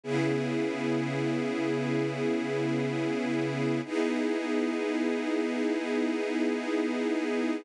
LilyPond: \new Staff { \time 4/4 \key e \major \tempo 4 = 126 <cis b e' gis'>1~ | <cis b e' gis'>1 | <b dis' e' gis'>1~ | <b dis' e' gis'>1 | }